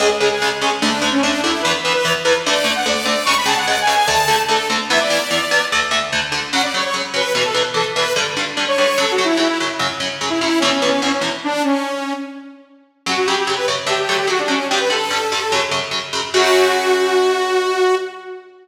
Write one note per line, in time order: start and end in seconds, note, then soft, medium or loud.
0.00 0.08 C#2 loud
0.00 0.08 C#3 loud
0.00 0.08 G#3 loud
0.00 0.10 G#4 medium
0.20 0.29 C#2 medium
0.20 0.29 C#3 medium
0.20 0.29 G#3 medium
0.20 0.29 G#4 medium
0.30 0.49 G#4 medium
0.42 0.50 C#2 medium
0.42 0.50 C#3 medium
0.42 0.50 G#3 medium
0.61 0.70 C#2 medium
0.61 0.70 C#3 medium
0.61 0.70 G#3 medium
0.61 0.71 G#4 medium
0.81 0.90 D2 loud
0.81 0.90 D3 loud
0.81 0.90 A3 medium
0.81 1.10 D4 medium
1.02 1.10 D2 medium
1.02 1.10 D3 medium
1.02 1.10 A3 medium
1.12 1.21 C#4 medium
1.22 1.31 D2 medium
1.22 1.31 D3 medium
1.22 1.31 A3 medium
1.22 1.41 D4 medium
1.43 1.52 D2 loud
1.43 1.52 D3 medium
1.43 1.52 A3 medium
1.43 1.62 E4 medium
1.62 1.73 E2 loud
1.62 1.73 E3 loud
1.62 1.73 B3 loud
1.62 1.72 B4 medium
1.83 1.93 E2 medium
1.83 1.93 E3 medium
1.83 1.93 B3 medium
1.83 1.93 B4 medium
1.93 2.12 B4 medium
2.05 2.13 E2 medium
2.05 2.13 E3 medium
2.05 2.13 B3 medium
2.25 2.33 E2 medium
2.25 2.33 E3 medium
2.25 2.33 B3 medium
2.25 2.34 B4 medium
2.46 2.55 D2 loud
2.46 2.55 D3 loud
2.46 2.55 A3 loud
2.46 2.74 D5 medium
2.64 2.72 D2 medium
2.64 2.72 D3 medium
2.64 2.72 A3 loud
2.75 2.85 F#5 medium
2.86 2.94 D2 loud
2.86 2.94 D3 medium
2.86 2.94 A3 medium
2.86 3.05 D5 medium
3.05 3.14 D2 medium
3.05 3.14 D3 medium
3.05 3.14 A3 loud
3.05 3.26 D5 medium
3.25 3.35 C#2 medium
3.25 3.35 C#3 loud
3.25 3.35 G#3 medium
3.25 3.35 C#6 medium
3.37 3.47 B5 medium
3.46 3.54 C#2 loud
3.46 3.54 C#3 loud
3.46 3.54 G#3 medium
3.46 3.56 A5 medium
3.56 3.66 F#5 medium
3.66 3.76 C#2 medium
3.66 3.76 C#3 medium
3.66 3.76 G#3 medium
3.66 3.79 F#5 medium
3.81 3.94 G#5 medium
3.87 3.95 C#2 medium
3.87 3.95 C#3 medium
3.87 3.95 G#3 medium
3.95 4.08 G#5 medium
4.06 4.16 D2 loud
4.06 4.16 D3 loud
4.06 4.16 A3 loud
4.06 4.41 A5 medium
4.28 4.36 D2 medium
4.28 4.36 D3 medium
4.28 4.36 A3 medium
4.48 4.57 D2 medium
4.48 4.57 D3 medium
4.48 4.57 A3 medium
4.48 4.68 A4 medium
4.70 4.78 D2 medium
4.70 4.78 D3 medium
4.70 4.78 A3 medium
4.89 4.98 E2 loud
4.89 4.98 E3 loud
4.89 4.98 B3 loud
4.89 4.99 E5 medium
4.99 5.65 D5 medium
5.10 5.18 E2 medium
5.10 5.18 E3 medium
5.10 5.18 B3 medium
5.31 5.39 E2 medium
5.31 5.39 E3 medium
5.31 5.39 B3 medium
5.51 5.59 E2 medium
5.51 5.59 E3 medium
5.51 5.59 B3 medium
5.72 5.80 D2 loud
5.72 5.80 D3 medium
5.72 5.80 A3 loud
5.91 5.99 D2 medium
5.91 5.99 D3 medium
5.91 5.99 A3 loud
6.12 6.21 D2 medium
6.12 6.21 D3 medium
6.12 6.21 A3 medium
6.32 6.40 D2 medium
6.32 6.40 D3 loud
6.32 6.40 A3 medium
6.52 6.61 F#2 medium
6.52 6.61 C#3 loud
6.52 6.61 F#3 medium
6.52 6.62 F#5 medium
6.63 6.73 D5 medium
6.74 6.82 F#2 medium
6.74 6.82 C#3 medium
6.74 6.82 F#3 medium
6.74 6.84 C#5 medium
6.84 6.94 C#5 medium
6.94 7.02 F#2 medium
6.94 7.02 C#3 medium
6.94 7.02 F#3 medium
7.14 7.22 F#2 medium
7.14 7.22 C#3 medium
7.14 7.22 F#3 loud
7.14 7.33 B4 medium
7.34 7.43 E2 medium
7.34 7.43 B2 medium
7.34 7.43 E3 medium
7.34 7.44 B4 medium
7.44 7.54 A4 medium
7.54 7.62 E2 medium
7.54 7.62 B2 medium
7.54 7.62 E3 medium
7.74 7.82 E2 medium
7.74 7.82 B2 medium
7.74 7.82 E3 medium
7.74 7.85 A4 medium
7.96 8.04 E2 medium
7.96 8.04 B2 medium
7.96 8.04 E3 medium
7.96 8.13 B4 medium
8.16 8.24 G2 medium
8.16 8.24 D3 loud
8.16 8.24 G3 medium
8.37 8.45 G2 medium
8.37 8.45 D3 medium
8.37 8.45 G3 medium
8.57 8.65 G2 medium
8.57 8.65 D3 medium
8.57 8.65 G3 medium
8.68 8.77 C#5 medium
8.78 8.86 G2 medium
8.78 8.86 D3 medium
8.78 8.86 G3 medium
8.78 8.98 C#5 medium
8.98 9.06 F#2 medium
8.98 9.06 C#3 loud
8.98 9.06 F#3 loud
8.98 9.13 A4 medium
9.11 9.24 F#4 medium
9.18 9.26 F#2 medium
9.18 9.26 C#3 medium
9.18 9.26 F#3 medium
9.24 9.37 E4 medium
9.37 9.45 F#2 medium
9.37 9.45 C#3 medium
9.37 9.45 F#3 medium
9.37 9.48 E4 medium
9.48 9.58 E4 medium
9.60 9.68 F#2 medium
9.60 9.68 C#3 medium
9.60 9.68 F#3 medium
9.79 9.87 F#2 medium
9.79 9.87 C#3 medium
9.79 9.87 F#3 medium
10.00 10.08 F#2 medium
10.00 10.08 C#3 medium
10.00 10.08 F#3 medium
10.21 10.29 F#2 medium
10.21 10.29 C#3 medium
10.21 10.29 F#3 medium
10.30 10.39 E4 medium
10.40 10.49 F#2 medium
10.40 10.49 C#3 medium
10.40 10.49 F#3 medium
10.40 10.60 E4 medium
10.59 10.70 E2 loud
10.59 10.70 B2 medium
10.59 10.70 E3 loud
10.59 10.72 C#4 medium
10.74 10.87 C#4 medium
10.82 10.90 E2 medium
10.82 10.90 B2 medium
10.82 10.90 E3 medium
10.88 11.01 C#4 medium
11.02 11.10 E2 medium
11.02 11.10 B2 medium
11.02 11.10 E3 medium
11.02 11.12 C#4 medium
11.13 11.22 C#4 medium
11.21 11.29 E2 medium
11.21 11.29 B2 medium
11.21 11.29 E3 medium
11.44 11.62 D4 medium
11.64 12.13 C#4 medium
13.06 13.14 F#2 medium
13.06 13.14 C#3 loud
13.06 13.14 F#3 medium
13.06 13.17 F#4 medium
13.17 13.27 F#4 medium
13.26 13.36 F#2 medium
13.26 13.36 C#3 medium
13.26 13.36 F#3 medium
13.26 13.36 G4 medium
13.39 13.48 G4 medium
13.47 13.55 F#2 medium
13.47 13.55 C#3 medium
13.47 13.55 F#3 medium
13.56 13.66 B4 medium
13.68 13.76 F#2 medium
13.68 13.76 C#3 medium
13.68 13.76 F#3 medium
13.86 13.95 D3 loud
13.86 13.95 F#3 medium
13.86 13.95 A3 medium
13.86 13.98 G4 medium
13.99 14.17 G4 medium
14.09 14.17 D3 medium
14.09 14.17 F#3 medium
14.09 14.17 A3 medium
14.18 14.27 G4 medium
14.27 14.35 D3 medium
14.27 14.35 F#3 medium
14.27 14.35 A3 medium
14.27 14.40 F#4 medium
14.39 14.49 D4 medium
14.48 14.56 D3 medium
14.48 14.56 F#3 medium
14.48 14.56 A3 medium
14.48 14.67 C#4 medium
14.69 14.79 G2 loud
14.69 14.79 D3 medium
14.69 14.79 G3 medium
14.69 14.79 G4 medium
14.79 14.89 B4 medium
14.90 14.98 G2 medium
14.90 14.98 D3 medium
14.90 14.98 G3 medium
14.90 15.62 A4 medium
15.10 15.19 G2 medium
15.10 15.19 D3 medium
15.10 15.19 G3 medium
15.32 15.40 G2 medium
15.32 15.40 D3 medium
15.32 15.40 G3 medium
15.52 15.60 F#2 loud
15.52 15.60 C#3 loud
15.52 15.60 F#3 medium
15.71 15.80 F#2 medium
15.71 15.80 C#3 medium
15.71 15.80 F#3 medium
15.91 15.99 F#2 medium
15.91 15.99 C#3 medium
15.91 15.99 F#3 medium
16.13 16.21 F#2 medium
16.13 16.21 C#3 medium
16.13 16.21 F#3 medium
16.34 17.96 F#2 loud
16.34 17.96 C#3 loud
16.34 17.96 F#3 medium
16.34 17.95 F#4 loud